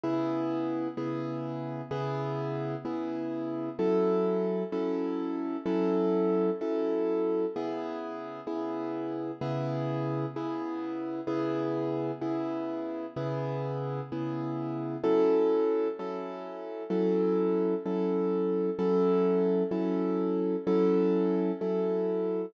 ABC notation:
X:1
M:4/4
L:1/8
Q:1/4=64
K:C#m
V:1 name="Acoustic Grand Piano"
[C,B,EG]2 [C,B,EG]2 [C,B,EG]2 [C,B,EG]2 | [F,CEA]2 [F,CEA]2 [F,CEA]2 [F,CEA]2 | [C,B,EG]2 [C,B,EG]2 [C,B,EG]2 [C,B,EG]2 | [C,B,EG]2 [C,B,EG]2 [C,B,EG]2 [C,B,EG]2 |
[F,CEA]2 [F,CEA]2 [F,CEA]2 [F,CEA]2 | [F,CEA]2 [F,CEA]2 [F,CEA]2 [F,CEA]2 |]